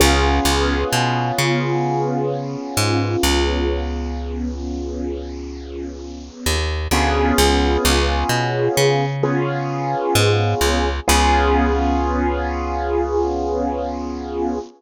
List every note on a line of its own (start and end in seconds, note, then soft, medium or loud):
0.00 0.40 C#2 loud
0.00 6.58 B3 medium
0.00 6.58 C#4 medium
0.00 6.58 F4 medium
0.00 6.58 G#4 medium
0.45 0.84 C#2 loud
0.93 1.32 B2 medium
1.38 2.56 C#3 medium
2.77 3.16 G#2 loud
3.23 6.30 C#2 loud
6.46 6.88 D#2 medium
6.91 7.33 D2 medium
6.91 9.05 B3 loud
6.91 9.05 C#4 medium
6.91 9.05 F4 medium
6.91 9.05 G#4 medium
7.38 7.77 C#2 loud
7.85 8.24 C#2 loud
8.29 8.68 B2 medium
8.77 9.95 C#3 loud
9.23 10.89 B3 medium
9.23 10.89 C#4 medium
9.23 10.89 F4 medium
9.23 10.89 G#4 medium
10.15 10.54 G#2 loud
10.61 11.00 C#2 medium
11.08 14.60 C#2 loud
11.08 14.58 B3 loud
11.08 14.58 C#4 medium
11.08 14.58 F4 loud
11.08 14.58 G#4 loud